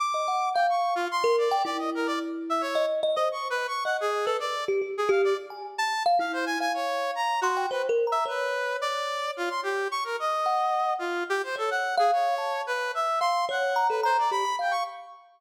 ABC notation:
X:1
M:3/4
L:1/16
Q:1/4=109
K:none
V:1 name="Brass Section"
d'4 g _d'2 F c'2 =d2 | d _e _B d z2 =e _d2 z2 _e | (3_d'2 B2 d'2 _g _A2 =A =d2 z2 | _A f d z3 =a2 z f c _a |
_a _d3 _b2 _G2 =B z2 e | B4 d4 F c' G2 | _d' _B _e6 F2 G c | A _g2 _A _d4 B2 e2 |
c'2 _g3 B c d b2 =g _d' |]
V:2 name="Kalimba"
z _e _g2 f4 z _B2 =g | E8 _e2 e c | z4 _e2 z B z2 G G | z G2 z _a z3 f E3 |
f6 c' g (3c2 _B2 _b2 | _d12 | z4 _g4 z4 | _d3 f3 a2 z4 |
f2 _d2 _b A b2 G =b f2 |]